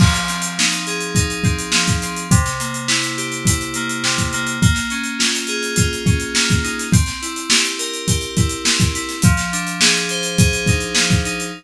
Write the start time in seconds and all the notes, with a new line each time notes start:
0.00 F3, kick, crash
0.14 snare, closed hi-hat
0.28 C4, closed hi-hat
0.42 closed hi-hat
0.58 D#4, snare
0.71 snare, closed hi-hat
0.87 G#4, closed hi-hat
1.00 closed hi-hat
1.15 D#4, kick, closed hi-hat
1.30 closed hi-hat
1.44 C4, kick, closed hi-hat
1.59 closed hi-hat
1.72 F3, snare
1.87 kick, closed hi-hat
2.02 C4, closed hi-hat
2.16 closed hi-hat
2.31 C3, kick, closed hi-hat
2.46 snare, closed hi-hat
2.60 A#3, closed hi-hat
2.74 closed hi-hat
2.88 E4, snare
3.02 snare, closed hi-hat
3.17 G4, closed hi-hat
3.32 closed hi-hat
3.45 E4, kick, closed hi-hat
3.61 closed hi-hat
3.74 A#3, closed hi-hat
3.89 closed hi-hat
4.04 C3, snare
4.18 kick, closed hi-hat
4.33 A#3, closed hi-hat
4.47 closed hi-hat
4.62 A#3, kick, closed hi-hat
4.75 snare, closed hi-hat
4.90 C#4, closed hi-hat
5.04 closed hi-hat
5.19 F4, snare
5.35 closed hi-hat
5.47 G#4, closed hi-hat
5.63 closed hi-hat
5.76 F4, kick, closed hi-hat
5.93 closed hi-hat
6.06 C#4, kick, closed hi-hat
6.20 closed hi-hat
6.35 A#3, snare
6.50 kick, snare, closed hi-hat
6.63 D#4, closed hi-hat
6.79 snare, closed hi-hat
6.92 C4, kick, closed hi-hat
7.06 snare, closed hi-hat
7.22 E4, closed hi-hat
7.36 closed hi-hat
7.50 G4, snare
7.64 closed hi-hat
7.78 A#4, closed hi-hat
7.94 closed hi-hat
8.07 G4, kick, closed hi-hat
8.21 closed hi-hat
8.37 E4, kick, closed hi-hat
8.49 closed hi-hat
8.65 C4, snare
8.80 kick, closed hi-hat
8.93 E4, snare, closed hi-hat
9.09 snare, closed hi-hat
9.22 F3, kick, closed hi-hat
9.37 snare, closed hi-hat
9.52 D4, closed hi-hat
9.67 closed hi-hat
9.81 G#4, snare
9.95 closed hi-hat
10.09 C5, closed hi-hat
10.23 closed hi-hat
10.38 G#4, kick, closed hi-hat
10.53 closed hi-hat
10.66 D#4, kick, closed hi-hat
10.80 closed hi-hat
10.95 F3, snare
11.11 kick, closed hi-hat
11.25 D#4, closed hi-hat
11.40 closed hi-hat